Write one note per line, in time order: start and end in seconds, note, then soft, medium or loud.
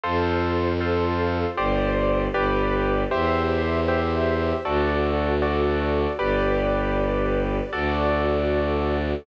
0.04 1.45 F2 medium
0.04 0.73 F4 medium
0.04 1.56 F4 medium
0.04 0.73 A4 medium
0.04 1.56 A4 medium
0.04 0.73 C5 medium
0.04 1.56 C5 medium
0.80 1.50 F4 medium
0.80 1.50 A4 medium
0.80 1.50 C5 medium
1.57 2.28 G1 medium
1.57 2.27 G4 medium
1.57 2.34 G4 medium
1.57 2.27 C5 medium
1.57 2.34 C5 medium
1.57 2.27 D5 medium
1.57 2.34 D5 loud
2.34 3.05 G1 medium
2.34 3.04 G4 loud
2.34 3.10 G4 medium
2.34 3.04 B4 medium
2.34 3.10 B4 loud
2.34 3.04 D5 medium
2.34 3.10 D5 medium
3.11 4.53 E2 medium
3.11 4.63 G4 medium
3.11 3.80 G4 medium
3.11 4.63 C5 loud
3.11 3.80 C5 loud
3.11 4.63 E5 medium
3.11 3.80 E5 medium
3.88 4.57 G4 medium
3.88 4.57 C5 medium
3.88 4.57 E5 medium
4.65 6.07 D2 medium
4.65 5.34 F#4 medium
4.65 6.18 F#4 loud
4.65 5.34 A4 medium
4.65 6.18 A4 loud
4.65 5.34 D5 medium
4.65 6.18 D5 medium
5.42 6.11 F#4 medium
5.42 6.11 A4 medium
5.42 6.11 D5 medium
6.19 7.61 G1 medium
6.19 7.71 G4 loud
6.19 7.57 G4 medium
6.19 7.71 B4 loud
6.19 7.57 B4 medium
6.19 7.71 D5 loud
6.19 7.57 D5 medium
7.73 9.15 D2 medium
7.73 9.11 F#4 medium
7.73 9.25 F#4 loud
7.73 9.11 A4 medium
7.73 9.25 A4 medium
7.73 9.11 D5 loud
7.73 9.25 D5 medium